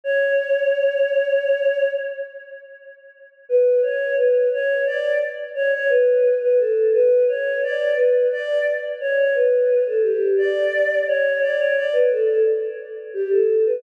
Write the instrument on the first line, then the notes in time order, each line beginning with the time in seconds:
choir aahs
0.04 C#5
3.49 B4
3.82 C#5
4.17 B4
4.52 C#5
4.86 D5
5.55 C#5
5.73 C#5
5.89 B4
6.41 B4
6.58 A4
6.93 B4
7.28 C#5
7.63 D5
7.96 B4
8.32 D5
9.00 C#5
9.17 C#5
9.34 B4
9.86 A4
10.03 G4
10.38 D5
11.07 C#5
11.41 D5
11.58 C#5
11.76 D5
11.93 B4
12.11 A4
12.28 A4
13.14 G4
13.31 A4
13.66 B4